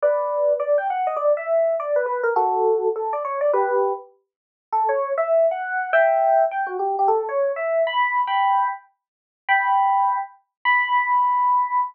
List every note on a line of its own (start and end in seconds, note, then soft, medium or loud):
0.02 0.53 B4 medium
0.02 0.53 D5 medium
0.60 0.77 D5 medium
0.78 0.87 G5 medium
0.90 1.07 F#5 medium
1.07 1.18 D#5 medium
1.16 1.33 D5 medium
1.37 1.75 E5 medium
1.80 1.97 D5 medium
1.96 2.06 B4 medium
2.06 2.21 B4 medium
2.23 2.34 A#4 medium
2.36 2.88 F#4 medium
2.36 2.88 A4 medium
2.96 3.13 A4 medium
3.13 3.23 D5 medium
3.25 3.39 C#5 medium
3.41 3.51 D5 medium
3.53 3.92 G4 medium
3.53 3.92 B4 medium
4.72 4.90 A4 medium
4.89 5.13 C#5 medium
5.18 5.46 E5 medium
5.51 5.90 F#5 medium
5.93 6.44 E5 medium
5.93 6.44 G5 medium
6.51 6.69 G5 medium
6.67 6.77 F#4 medium
6.79 6.96 G4 medium
6.99 7.10 G4 medium
7.08 7.25 A4 medium
7.29 7.52 C#5 medium
7.56 7.82 E5 medium
7.87 8.21 B5 medium
8.27 8.68 G5 medium
8.27 8.68 B5 medium
9.49 10.18 G5 medium
9.49 10.18 B5 medium
10.65 11.81 B5 loud